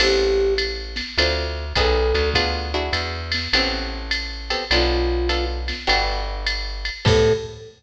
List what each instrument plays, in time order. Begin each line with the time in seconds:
0.00 electric bass (finger) A1, acoustic guitar (steel) B3 C4 G4 A4, flute G4, crash, ride
0.58 hi-hat pedal, ride
0.96 snare, ride
1.18 electric bass (finger) D2, acoustic guitar (steel) C4 D4 F4 A4, ride
1.75 electric bass (finger) B1, acoustic guitar (steel) B3 D#4 G#4 A4, flute A4, kick, hi-hat pedal, ride
2.14 electric bass (finger) D2, ride
2.34 acoustic guitar (steel) B3 D4 F4 G#4, kick, ride
2.74 acoustic guitar (steel) D4 E4 F#4 G#4
2.93 electric bass (finger) E2, hi-hat pedal, ride
3.32 snare, ride
3.53 electric bass (finger) A1, acoustic guitar (steel) B3 C4 G4 A4, ride
4.11 hi-hat pedal, ride
4.50 acoustic guitar (steel) B3 C4 G4 A4, ride
4.71 electric bass (finger) B1, acoustic guitar (steel) B3 D4 F4 A4, flute F4, ride
5.29 acoustic guitar (steel) B3 D4 F4 A4, hi-hat pedal, ride
5.68 snare, ride
5.87 electric bass (finger) G1, acoustic guitar (steel) B3 D4 F#4 G4, ride
6.46 hi-hat pedal, ride
6.85 ride
7.05 electric bass (finger) A2, acoustic guitar (steel) B3 C4 G4 A4, flute A4, kick, crash